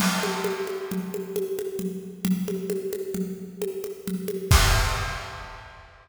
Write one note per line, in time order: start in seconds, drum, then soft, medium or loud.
0.00 crash medium
0.00 low conga medium
0.23 high conga medium
0.44 high conga medium
0.67 high conga medium
0.91 low conga medium
1.14 high conga medium
1.36 high conga medium
1.59 high conga medium
1.79 low conga medium
2.25 low conga medium
2.48 high conga medium
2.70 high conga medium
2.93 high conga medium
3.14 low conga medium
3.62 high conga medium
3.84 high conga medium
4.08 low conga medium
4.28 high conga medium
4.51 kick loud
4.51 crash loud